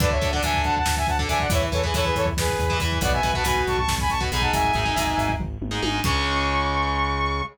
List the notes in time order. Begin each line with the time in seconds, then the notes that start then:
0.00 D2 D4 A4 B4 D5, kick, crash
0.11 C#5 E5, kick
0.21 D2 D4 A4, kick, closed hi-hat
0.32 D4 A4 D5 F#5, kick
0.43 D2 D4 A4 E5 G#5, kick, closed hi-hat
0.54 kick
0.64 D2 F#5 A5, kick, closed hi-hat
0.77 F#5 A5, kick
0.86 D2, kick, snare
0.97 E5 G#5, kick
1.07 D2 F#5 A5, kick, closed hi-hat
1.19 D4 A4, kick
1.29 D2 D4 A4 E5 G#5, kick, closed hi-hat
1.40 D5 F#5, kick
1.50 E2 E4 B4 C#5 E5, kick, closed hi-hat
1.62 kick
1.72 E2 E4 A4 B4 C#5, kick, closed hi-hat
1.83 E4 G#4 B4, kick
1.94 E2 E4 A4 B4 C#5, kick, closed hi-hat
2.05 G#4 B4, kick
2.16 E2 A4 C#5, kick, closed hi-hat
2.26 kick
2.37 E2 G#4 B4, kick, snare
2.48 kick
2.59 E2, kick, closed hi-hat
2.70 E4 B4, kick
2.80 E2 E4 B4, kick, closed hi-hat
2.92 kick
3.01 B1 F#4 B4 D5 F#5, kick, closed hi-hat
3.12 E5 G#5, kick
3.23 B1 F#4 B4, kick, closed hi-hat
3.33 F#4 B4 F#5 A5, kick
3.44 B1 F#4 B4 G#5 B5, kick, closed hi-hat
3.56 kick
3.67 B1 A5 C#6, kick, closed hi-hat
3.77 A5 C#6, kick
3.88 B1, kick, snare
3.98 G#5 B5, kick
4.09 B1 A5 C#6, kick, closed hi-hat
4.20 F#4 B4, kick
4.32 B1 D#4 G#4 G#5 B5, kick, closed hi-hat
4.41 F#5 A5, kick
4.53 G#1 E5 G#5, kick, closed hi-hat
4.64 kick
4.73 G#1 D#4 G#4, kick, closed hi-hat
4.85 D#4 G#4, kick
4.96 G#1 D#4 G#4, kick, closed hi-hat
5.07 kick
5.18 G#1, kick, closed hi-hat
5.29 kick
5.39 G#1, kick, floor tom
5.61 G#1, mid tom
5.71 D#4 G#4
5.82 G#1 D#4 G#4, high tom
6.04 C#2 C#3 G#3 C#6, kick, crash